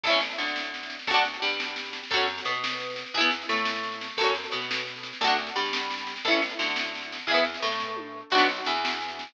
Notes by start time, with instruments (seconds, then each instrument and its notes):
0.04 electric bass (finger) A1, acoustic guitar (steel) E4 A4, kick, snare, crash
0.10 acoustic guitar (steel) C#4, snare
0.20 snare
0.31 snare
0.38 electric bass (finger) D2, acoustic guitar (steel) D3, snare
0.46 snare
0.56 snare
0.63 snare
0.74 snare
0.83 snare
0.90 snare
0.99 snare
1.07 electric bass (finger) D2, acoustic guitar (steel) F#4 A4, kick, snare
1.14 acoustic guitar (steel) D4, snare
1.25 snare
1.33 snare
1.42 electric bass (finger) G2, acoustic guitar (steel) G3, snare
1.50 snare
1.60 snare
1.68 snare
1.76 snare
1.85 snare
1.93 snare
2.03 snare
2.10 electric bass (finger) F#2, acoustic guitar (steel) F#4 A4, kick, snare
2.17 acoustic guitar (steel) C#4, snare
2.27 snare
2.38 snare
2.45 electric bass (finger) B2, acoustic guitar (steel) B3, snare
2.54 snare
2.64 snare
2.73 snare
2.80 snare
2.90 snare
2.96 snare
3.06 snare
3.14 electric bass (finger) E2, acoustic guitar (steel) E4 G#4, kick, snare
3.20 acoustic guitar (steel) B3, snare
3.31 snare
3.42 snare
3.49 electric bass (finger) A2, acoustic guitar (steel) A3, snare
3.56 snare
3.65 snare
3.75 snare
3.83 snare
3.92 snare
4.01 snare
4.09 snare
4.17 electric bass (finger) F#2, acoustic guitar (steel) F#4 A4, kick, snare, crash
4.24 acoustic guitar (steel) C#4, snare
4.35 snare
4.44 snare
4.51 electric bass (finger) B2, acoustic guitar (steel) B3, snare
4.62 snare
4.71 snare
4.77 snare
4.87 snare
4.96 snare
5.03 snare
5.13 snare
5.21 electric bass (finger) D2, acoustic guitar (steel) F#4 A4, kick, snare
5.27 acoustic guitar (steel) D4, snare
5.38 snare
5.47 snare
5.56 electric bass (finger) G2, acoustic guitar (steel) G3, snare
5.66 snare
5.73 snare
5.83 snare
5.90 snare
5.98 snare
6.07 snare
6.16 snare
6.25 electric bass (finger) A1, acoustic guitar (steel) E4 A4, kick, snare
6.31 acoustic guitar (steel) C#4, snare
6.42 snare
6.49 snare
6.59 electric bass (finger) D2, acoustic guitar (steel) D3, snare
6.67 snare
6.76 snare
6.84 snare
6.95 snare
7.02 snare
7.12 snare
7.19 snare
7.27 electric bass (finger) E2, acoustic guitar (steel) G#4, kick, snare
7.31 acoustic guitar (steel) B3 E4
7.35 snare
7.45 snare
7.54 snare
7.62 electric bass (finger) A2, acoustic guitar (steel) A3, snare
7.72 snare
7.80 kick, snare
7.96 high tom
8.30 electric bass (finger) B1, acoustic guitar (steel) F#4, kick, snare, crash
8.35 acoustic guitar (steel) B3 D4, snare
8.49 snare
8.56 snare
8.65 electric bass (finger) E2, acoustic guitar (steel) E3, snare
8.76 snare
8.85 snare
8.92 snare
9.01 snare
9.08 snare
9.19 snare
9.27 snare